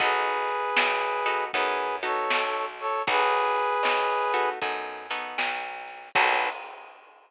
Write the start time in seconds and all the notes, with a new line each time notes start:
0.00 B1 B3 D#4 F#4 G#4 A4 B4, kick, closed hi-hat
0.49 closed hi-hat
0.76 B1, snare
1.26 B3 D#4 F#4 A4, closed hi-hat
1.53 F#2 B3 D#4 F#4 G#4 A4 B4, kick, closed hi-hat
2.03 B3 D#4 F#4 A4 C#5, snare, closed hi-hat
2.30 B1, snare
2.79 A4 C#5, closed hi-hat
3.07 B1 B3 D#4 F#4 G#4 A4 B4, kick, closed hi-hat
3.56 closed hi-hat
3.83 B1, snare
4.34 B3 D#4 F#4 A4, closed hi-hat
4.62 F#2 B3 D#4 F#4 A4, kick, closed hi-hat
5.10 B3 D#4 F#4 A4, snare, closed hi-hat
5.38 B1, snare
5.88 closed hi-hat
6.15 B1 B3 D#4 F#4 A4 B4, kick, crash